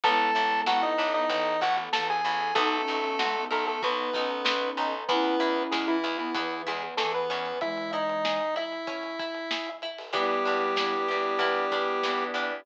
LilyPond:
<<
  \new Staff \with { instrumentName = "Lead 1 (square)" } { \time 4/4 \key e \major \tempo 4 = 95 <a' a''>4 <fis' fis''>16 <dis' dis''>8 <dis' dis''>8. <fis' fis''>16 r16 <a' a''>16 <gis' gis''>8. | <a a'>4. <a a'>16 <a a'>16 <b b'>4. r8 | <b b'>4 <gis gis'>16 <e e'>8 <e e'>8. <gis gis'>16 r16 <a a'>16 <b b'>8. | <e' e''>8 <dis' dis''>4 <e' e''>2 r8 |
\key e \minor <g g'>1 | }
  \new Staff \with { instrumentName = "Flute" } { \time 4/4 \key e \major <gis b>4. r16 b16 e4 e4 | \tuplet 3/2 { dis'8 cis'8 cis'8 } gis16 b8. b8 cis'4. | <cis' e'>4. r16 b16 e4 e4 | <e gis>4. r2 r8 |
\key e \minor <g b>4. b8 b2 | }
  \new Staff \with { instrumentName = "Drawbar Organ" } { \time 4/4 \key e \major r1 | r1 | r1 | r1 |
\key e \minor <b d' e' g'>1 | }
  \new Staff \with { instrumentName = "Pizzicato Strings" } { \time 4/4 \key e \major b8 e'8 a'8 d'8 b8 e'8 a'8 e'8 | b8 dis'8 fis'8 ais'8 fis'8 dis'8 b8 dis'8 | b8 e'8 gis'8 e'8 b8 e'8 gis'8 cis'8~ | cis'8 e'8 gis'8 e'8 cis'8 e'8 gis'8 e'8 |
\key e \minor b8 d'8 e'8 g'8 e'8 d'8 b8 d'8 | }
  \new Staff \with { instrumentName = "Electric Bass (finger)" } { \clef bass \time 4/4 \key e \major a,,8 a,,8 a,,8 a,,8 a,,8 a,,8 a,,8 a,,8 | b,,8 b,,8 b,,8 b,,8 b,,8 b,,8 b,,8 b,,8 | e,8 e,8 e,8 e,8 e,8 e,8 e,8 e,8 | r1 |
\key e \minor e,8 e,8 e,8 e,8 e,8 e,8 e,8 e,8 | }
  \new Staff \with { instrumentName = "Pad 5 (bowed)" } { \time 4/4 \key e \major <b e' a'>2 <a b a'>2 | <b dis' fis' a'>2 <b dis' a' b'>2 | <b e' gis'>2 <b gis' b'>2 | r1 |
\key e \minor <b d' e' g'>2 <b d' g' b'>2 | }
  \new DrumStaff \with { instrumentName = "Drums" } \drummode { \time 4/4 <hh bd>16 hh16 hh16 hh16 sn16 hh16 hh16 hh16 <hh bd>16 hh16 <hh bd>16 hh16 sn16 hh16 hh16 hh16 | <hh bd>16 hh16 hh16 hh16 sn16 hh16 hh16 hh16 <hh bd>16 hh16 <hh bd>16 hh16 sn16 hh16 hh16 hh16 | <hh bd>16 hh16 hh16 hh16 sn16 hh16 hh16 hh16 <hh bd>16 hh16 <hh bd>16 hh16 sn16 hh16 hh16 hh16 | <hh bd>16 hh16 hh16 hh16 sn16 hh16 hh16 hh16 <hh bd>16 hh16 <hh bd>16 hh16 sn16 hh16 hh16 hho16 |
<hh bd>8 hh8 sn4 <hh bd>8 <hh bd>8 sn8 hh8 | }
>>